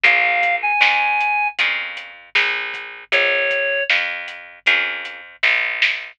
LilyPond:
<<
  \new Staff \with { instrumentName = "Clarinet" } { \time 4/4 \key bes \minor \tempo 4 = 78 f''8. aes''4~ aes''16 r2 | des''4 r2. | }
  \new Staff \with { instrumentName = "Acoustic Guitar (steel)" } { \time 4/4 \key bes \minor <bes des' f' aes'>2 <bes des' f' aes'>2~ | <bes des' f' aes'>2 <bes des' f' aes'>2 | }
  \new Staff \with { instrumentName = "Electric Bass (finger)" } { \clef bass \time 4/4 \key bes \minor bes,,4 f,4 f,4 bes,,4 | bes,,4 f,4 f,4 bes,,4 | }
  \new DrumStaff \with { instrumentName = "Drums" } \drummode { \time 4/4 <hh bd>8 <hh bd>8 sn8 hh8 <hh bd>8 hh8 sn8 <hh bd>8 | <hh bd>8 <hh bd>8 sn8 hh8 <hh bd>8 hh8 <bd sn>8 sn8 | }
>>